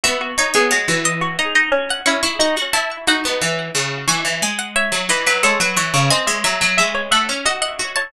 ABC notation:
X:1
M:3/4
L:1/16
Q:1/4=89
K:C#m
V:1 name="Pizzicato Strings"
e2 c c c z d z d d z f | c' c' c' z a z f4 z2 | g2 g f e2 d B A B c2 | g2 e e e z f z f f z a |]
V:2 name="Pizzicato Strings"
F F2 G F F z F D D C2 | E2 D z3 F4 z2 | c4 c2 B2 c3 c | d e e2 e c e2 d d2 c |]
V:3 name="Pizzicato Strings"
B,2 D B, G, E,3 z4 | C E F F E2 D B, E,2 C,2 | E, E, G,3 F, E, F, G, F, E, C, | ^B, G, F, F, G,2 A, C F2 F2 |]